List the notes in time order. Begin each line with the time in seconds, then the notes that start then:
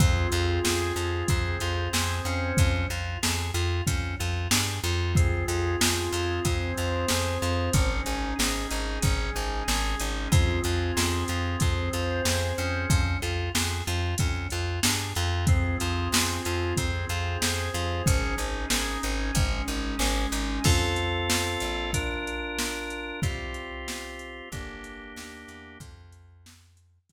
0.00 F2 C4 F4 G#4, kick, closed hi-hat
0.32 F2 F4, closed hi-hat
0.64 F2 G#4, snare
0.96 F2 F4, closed hi-hat
1.28 F2 C4 G#4 C5, kick, closed hi-hat
1.60 F2 F4, closed hi-hat
1.93 F2 G#4, snare
2.25 F2 C#4, closed hi-hat
2.57 F2, kick, closed hi-hat
2.90 F2 F4, closed hi-hat
3.23 F2 G#4, snare
3.54 F2 F4, closed hi-hat
3.87 F2 C#4, kick, closed hi-hat
4.19 F2 F4, closed hi-hat
4.51 G2 G#4, snare
4.83 F2 F4, closed hi-hat
5.15 C4 F4 G#4, kick, closed hi-hat
5.48 F2 F4, closed hi-hat
5.81 F2 G#4, snare
6.12 F2 F4, closed hi-hat
6.45 F2 C4 G#4 C5, kick, closed hi-hat
6.77 F2 F4, closed hi-hat
7.08 F2 G#4, snare
7.42 F2 F4, closed hi-hat
7.73 G#1 C#4 D#4 G#4, kick, closed hi-hat
8.06 G#1 D#4, closed hi-hat
8.39 G#1 G#4, snare
8.71 G#1 D#4, closed hi-hat
9.02 G#1 G#3 C#4 G#4, kick, closed hi-hat
9.35 G#1 D#4, closed hi-hat
9.68 G#1 G#4, snare
9.99 G#1 D#4, closed hi-hat
10.31 F2 C4 F4 G#4, kick, closed hi-hat
10.64 F2 F4, closed hi-hat
10.97 F2 G#4, snare
11.28 F2 F4, closed hi-hat
11.60 F2 C4 G#4 C5, kick, closed hi-hat
11.93 F2 F4, closed hi-hat
12.25 F2 G#4, snare
12.58 F2 C#4, closed hi-hat
12.90 F2, kick, closed hi-hat
13.22 F2 F4, closed hi-hat
13.55 F2 G#4, snare
13.87 F2 F4, closed hi-hat
14.18 F2 C#4, kick, closed hi-hat
14.50 F2 F4, closed hi-hat
14.83 G2 G#4, snare
15.15 F2 F4, closed hi-hat
15.47 C4 F4 G#4, kick, closed hi-hat
15.80 F2 F4, closed hi-hat
16.12 F2 G#4, snare
16.45 F2 F4, closed hi-hat
16.77 F2 C4 G#4 C5, kick, closed hi-hat
17.09 F2 F4, closed hi-hat
17.42 F2 G#4, snare
17.74 F2 F4, closed hi-hat
18.06 G#1 C#4 D#4 G#4, kick, closed hi-hat
18.38 G#1 D#4, closed hi-hat
18.70 G#1 G#4, snare
19.03 G#1 D#4, closed hi-hat
19.35 G#1 G#3 C#4 G#4, kick, closed hi-hat
19.68 G#1 D#4, closed hi-hat
19.99 G#1 G#4, snare
20.32 G#1 D#4, closed hi-hat
20.64 F2 C4 F4 A4, kick, crash
20.96 closed hi-hat
21.30 snare
21.60 A#1, closed hi-hat
21.93 D4 F4 A#4, kick, closed hi-hat
22.27 closed hi-hat
22.59 snare
22.90 closed hi-hat
23.22 C2 C4 F4 G4, kick, closed hi-hat
23.54 closed hi-hat
23.88 snare
24.19 closed hi-hat
24.52 G1 A#3 D4 G4, kick, closed hi-hat
24.84 closed hi-hat
25.16 D#2, snare
25.48 E2, closed hi-hat
25.80 F2, kick, closed hi-hat
26.12 closed hi-hat
26.46 snare
26.77 closed hi-hat
27.09 F2, kick, closed hi-hat